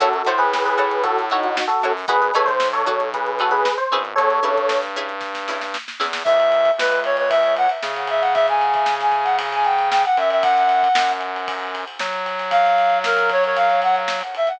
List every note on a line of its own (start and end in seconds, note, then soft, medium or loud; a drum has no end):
0.00 0.22 F#2 loud
0.00 0.09 E4 loud
0.00 0.09 F#4 medium
0.00 0.12 F#4 medium
0.00 0.12 A4 medium
0.00 0.09 A4 medium
0.00 0.09 C#5 loud
0.00 kick loud
0.00 closed hi-hat loud
0.13 0.28 F#4 soft
0.13 0.28 A4 medium
0.13 closed hi-hat medium
0.25 1.59 A2 medium
0.25 0.44 E4 medium
0.25 0.44 F#4 medium
0.25 0.44 A4 medium
0.25 0.39 C5 medium
0.25 0.44 C#5 medium
0.25 closed hi-hat medium
0.38 0.63 G#4 medium
0.38 0.63 B4 medium
0.38 snare soft
0.38 closed hi-hat medium
0.53 snare loud
0.64 1.02 G#4 medium
0.64 1.02 B4 medium
0.64 snare medium
0.64 closed hi-hat medium
0.77 0.96 E4 medium
0.77 0.96 F#4 medium
0.77 0.96 A4 medium
0.77 0.96 C#5 medium
0.77 closed hi-hat medium
0.91 closed hi-hat medium
1.03 1.25 F#4 medium
1.03 1.25 A4 medium
1.03 kick medium
1.03 closed hi-hat loud
1.18 snare soft
1.18 closed hi-hat medium
1.30 1.43 D#4 medium
1.30 1.49 E4 medium
1.30 1.49 F#4 medium
1.30 1.43 F#4 medium
1.30 1.49 A4 medium
1.30 1.49 C#5 loud
1.30 snare soft
1.30 closed hi-hat medium
1.43 1.65 D#4 medium
1.43 1.65 F#4 medium
1.43 closed hi-hat medium
1.57 snare loud
1.67 1.92 F#4 medium
1.67 1.92 A4 medium
1.67 closed hi-hat medium
1.82 2.05 F#2 medium
1.82 1.92 E4 medium
1.82 1.92 F#4 medium
1.82 1.92 A4 medium
1.82 1.92 C#5 medium
1.82 closed hi-hat medium
1.97 open hi-hat medium
2.07 2.31 G#1 loud
2.07 2.17 D#4 medium
2.07 2.17 F#4 loud
2.07 2.17 G#4 loud
2.07 2.21 G#4 medium
2.07 2.21 B4 medium
2.07 2.17 B4 medium
2.07 kick loud
2.07 closed hi-hat medium
2.21 2.34 G#4 medium
2.21 2.34 B4 medium
2.21 closed hi-hat medium
2.34 3.68 B1 medium
2.34 2.52 D#4 medium
2.34 2.52 F#4 medium
2.34 2.52 G#4 medium
2.34 2.47 A4 medium
2.34 2.52 B4 medium
2.34 2.47 C#5 medium
2.34 snare soft
2.34 closed hi-hat medium
2.46 2.67 C5 medium
2.46 kick medium
2.46 snare soft
2.46 closed hi-hat medium
2.60 snare loud
2.73 3.08 A4 medium
2.73 3.08 C#5 medium
2.73 snare medium
2.73 closed hi-hat medium
2.86 3.04 D#4 medium
2.86 3.04 F#4 medium
2.86 3.04 G#4 medium
2.86 3.04 B4 medium
2.86 kick medium
2.86 closed hi-hat medium
3.00 closed hi-hat medium
3.14 3.38 G#4 soft
3.14 3.38 B4 medium
3.14 kick medium
3.14 closed hi-hat loud
3.26 closed hi-hat medium
3.39 3.58 D#4 medium
3.39 3.58 F#4 medium
3.39 3.52 F#4 medium
3.39 3.58 G#4 medium
3.39 3.52 A4 medium
3.39 3.58 B4 medium
3.39 closed hi-hat medium
3.51 3.73 G#4 medium
3.51 3.73 B4 medium
3.51 closed hi-hat medium
3.65 snare loud
3.77 4.00 C5 medium
3.77 closed hi-hat medium
3.92 4.14 G#1 medium
3.92 4.27 C#4 medium
3.92 4.27 E4 medium
3.92 4.27 G#4 loud
3.92 4.27 B4 medium
3.92 closed hi-hat medium
4.05 closed hi-hat medium
4.16 4.40 E2 loud
4.16 4.79 A4 medium
4.16 4.79 C#5 medium
4.16 kick medium
4.16 closed hi-hat loud
4.30 closed hi-hat medium
4.42 5.77 G2 medium
4.42 4.61 C#4 medium
4.42 4.61 E4 medium
4.42 4.61 G#4 medium
4.42 4.61 B4 medium
4.42 closed hi-hat medium
4.57 kick medium
4.57 closed hi-hat medium
4.69 snare loud
4.82 snare medium
4.82 closed hi-hat medium
4.96 5.14 C#4 medium
4.96 5.14 E4 medium
4.96 5.14 G#4 medium
4.96 5.14 B4 medium
4.96 snare soft
4.96 closed hi-hat medium
5.08 snare soft
5.08 closed hi-hat medium
5.20 kick medium
5.20 snare medium
5.35 snare medium
5.48 5.66 C#4 medium
5.48 5.66 E4 medium
5.48 5.66 G#4 medium
5.48 5.66 B4 medium
5.48 snare medium
5.61 snare medium
5.74 snare medium
5.88 snare medium
5.99 6.22 E2 medium
5.99 6.09 C#4 medium
5.99 6.09 E4 medium
5.99 6.09 G#4 medium
5.99 6.09 B4 medium
5.99 snare medium
6.13 snare loud
6.24 6.71 C#2 medium
6.24 6.71 E5 medium
6.24 kick loud
6.24 crash loud
6.40 ride medium
6.52 ride medium
6.65 kick medium
6.65 ride medium
6.78 7.67 C#2 medium
6.78 7.00 B4 medium
6.78 snare loud
6.91 snare soft
6.91 ride medium
7.04 7.16 C#5 medium
7.04 ride medium
7.17 7.29 C#5 medium
7.17 ride medium
7.29 7.54 E5 medium
7.29 kick medium
7.29 ride loud
7.43 snare soft
7.43 ride medium
7.57 7.69 F#5 medium
7.57 ride medium
7.69 ride medium
7.83 10.05 C#3 medium
7.83 snare loud
7.96 ride medium
8.07 8.22 E5 medium
8.07 ride medium
8.21 8.33 F#5 medium
8.21 ride medium
8.34 8.46 E5 medium
8.34 kick loud
8.34 ride medium
8.48 8.94 G#5 medium
8.48 ride medium
8.61 ride medium
8.74 kick medium
8.74 ride medium
8.86 snare loud
9.00 9.26 G#5 medium
9.00 snare medium
9.00 ride medium
9.12 kick medium
9.12 ride medium
9.24 9.36 F#5 medium
9.24 ride medium
9.39 kick medium
9.39 ride loud
9.52 9.67 G#5 medium
9.52 snare soft
9.52 ride medium
9.65 9.89 G5 medium
9.65 ride medium
9.79 ride medium
9.90 10.02 G5 medium
9.90 snare loud
10.05 10.17 F#5 medium
10.05 ride medium
10.17 10.88 F#2 medium
10.17 10.30 E5 medium
10.17 snare soft
10.17 ride medium
10.30 10.43 E5 medium
10.30 ride medium
10.42 11.12 F#5 medium
10.42 kick loud
10.42 ride loud
10.57 snare soft
10.57 ride medium
10.69 ride medium
10.83 kick medium
10.83 ride medium
10.95 11.85 F#2 medium
10.95 snare loud
11.09 snare medium
11.09 ride medium
11.21 ride medium
11.36 ride medium
11.48 kick loud
11.48 ride loud
11.60 ride medium
11.75 ride medium
11.87 ride medium
11.99 14.22 F#3 medium
11.99 snare loud
12.13 ride medium
12.26 ride medium
12.39 snare soft
12.39 ride medium
12.50 12.98 F5 medium
12.50 kick medium
12.50 ride loud
12.65 snare soft
12.65 ride medium
12.78 ride medium
12.90 kick medium
12.90 ride medium
13.04 13.29 A#4 medium
13.04 snare loud
13.16 snare medium
13.16 ride medium
13.29 13.43 C#5 medium
13.29 kick medium
13.29 ride medium
13.44 13.57 C#5 medium
13.44 ride medium
13.56 13.80 F5 medium
13.56 kick medium
13.56 ride medium
13.70 ride medium
13.82 13.95 F#5 medium
13.82 snare soft
13.82 ride medium
13.96 ride medium
14.08 snare loud
14.21 ride medium
14.35 14.49 E5 medium
14.35 ride medium
14.47 14.59 F#5 medium
14.47 snare soft
14.47 ride medium